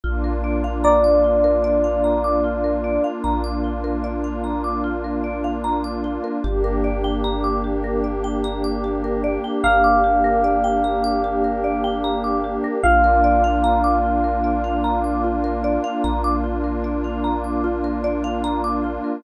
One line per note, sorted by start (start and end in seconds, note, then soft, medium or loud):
0.04 2.99 A#1 medium
0.04 6.37 A#3 medium
0.04 6.37 D4 medium
0.04 6.37 F4 medium
0.04 0.22 F4 medium
0.24 0.42 A#4 medium
0.44 0.62 D5 medium
0.64 0.82 F5 medium
0.84 3.09 D5 medium
0.84 1.02 A#5 medium
1.04 1.22 D6 medium
1.24 1.42 F4 medium
1.44 1.62 A#4 medium
1.64 1.82 D5 medium
1.84 2.02 F5 medium
2.04 2.22 A#5 medium
2.24 2.42 D6 medium
2.44 2.62 F4 medium
2.64 2.82 A#4 medium
2.84 3.02 D5 medium
3.04 3.22 F5 medium
3.24 6.19 A#1 medium
3.24 3.42 A#5 medium
3.44 3.62 D6 medium
3.64 3.82 F4 medium
3.84 4.02 A#4 medium
4.04 4.22 D5 medium
4.24 4.42 F5 medium
4.44 4.62 A#5 medium
4.64 4.82 D6 medium
4.84 5.02 F4 medium
5.04 5.22 A#4 medium
5.24 5.42 D5 medium
5.44 5.62 F5 medium
5.64 5.82 A#5 medium
5.84 6.02 D6 medium
6.04 6.22 F4 medium
6.24 6.42 A#4 medium
6.44 9.38 G1 loud
6.44 12.78 A#3 medium
6.44 12.78 D4 medium
6.44 6.62 G4 medium
6.44 12.78 G4 medium
6.64 6.82 A#4 medium
6.84 7.02 D5 medium
7.04 7.22 G5 medium
7.24 7.42 A#5 medium
7.44 7.62 D6 medium
7.64 7.82 G4 medium
7.84 8.02 A#4 medium
8.04 8.22 D5 medium
8.24 8.42 G5 medium
8.44 8.62 A#5 medium
8.64 8.82 D6 medium
8.84 9.02 G4 medium
9.04 9.22 A#4 medium
9.24 9.42 D5 medium
9.44 9.62 G5 medium
9.64 12.59 G1 medium
9.64 12.56 F5 medium
9.64 9.82 A#5 medium
9.84 10.02 D6 medium
10.04 10.22 G4 medium
10.24 10.42 A#4 medium
10.44 10.62 D5 medium
10.64 10.82 G5 medium
10.84 11.02 A#5 medium
11.04 11.22 D6 medium
11.24 11.42 G4 medium
11.44 11.62 A#4 medium
11.64 11.82 D5 medium
11.84 12.02 G5 medium
12.04 12.22 A#5 medium
12.24 12.42 D6 medium
12.44 12.62 G4 medium
12.64 12.82 A#4 medium
12.83 15.78 A#1 loud
12.83 19.17 A#3 medium
12.83 19.17 D4 medium
12.83 19.17 F4 medium
12.83 13.02 F4 medium
12.83 15.90 F5 medium
13.04 13.22 A#4 medium
13.24 13.42 D5 medium
13.44 13.62 F5 medium
13.64 13.82 A#5 medium
13.84 14.02 D6 medium
14.04 14.22 F4 medium
14.24 14.42 A#4 medium
14.44 14.62 D5 medium
14.64 14.82 F5 medium
14.84 15.02 A#5 medium
15.04 15.22 D6 medium
15.24 15.42 F4 medium
15.44 15.62 A#4 medium
15.64 15.82 D5 medium
15.84 16.02 F5 medium
16.04 18.98 A#1 medium
16.04 16.22 A#5 medium
16.24 16.42 D6 medium
16.44 16.62 F4 medium
16.64 16.82 A#4 medium
16.84 17.02 D5 medium
17.04 17.22 F5 medium
17.24 17.42 A#5 medium
17.44 17.62 D6 medium
17.64 17.82 F4 medium
17.84 18.02 A#4 medium
18.04 18.22 D5 medium
18.24 18.42 F5 medium
18.44 18.62 A#5 medium
18.64 18.82 D6 medium
18.84 19.02 F4 medium
19.04 19.22 A#4 medium